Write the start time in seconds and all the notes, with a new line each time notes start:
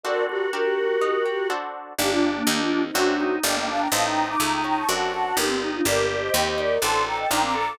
0.03 C4 D4 F#4 A4 A#4 D5
0.28 F#4 G4 A#4
0.53 D4 G4 A#4
1.01 D#4
1.26 G4
1.50 D4 F#4 A4 C5
1.98 G1 A#3 D4 D#4 G4
2.10 D4 F4
2.36 A#3 D4
2.47 D#2 A#3 D4 D#4 G4
2.59 D4 F4
2.71 D4 F4
2.83 C4 D#4
2.94 F#2 A3 C4 D4 F#4
3.20 D#4
3.43 G1 A#3 D4 G4 D#5 G5
3.57 A#3
3.67 D4 F5 A5
3.80 G5 A#5
3.92 A1 A3 C4 D#4 F5 A5
4.05 G5 A#5
4.28 A#5 D6
4.40 C#2 A3 A#5 D6
4.52 G5 A#5
4.64 C#4 G5 A#5
4.76 A5 C#6
4.88 F#2 A3 C4 D4 F#4 F#5 A5
5.14 F#4
5.36 G1 A#3 D4 D#4 G4 A#4
5.48 C4
5.60 D#4 G4
5.73 D4 F4
5.85 G1 A#3 D4 G4 A#4 D5
6.08 A#4 D5
6.22 C5 D#5
6.34 D#2 C4 D#5 G5
6.47 C5 D#5
6.58 D#4 A#4 D5
6.82 A1 C4 D4 F#4 A4 A5 C6
7.06 A4 G5 A#5
7.18 D#5 G5
7.30 A#1 D4 D#4 F4 A#4 G5 A#5
7.43 C4 A#5 D6
7.54 A4 A#5 D6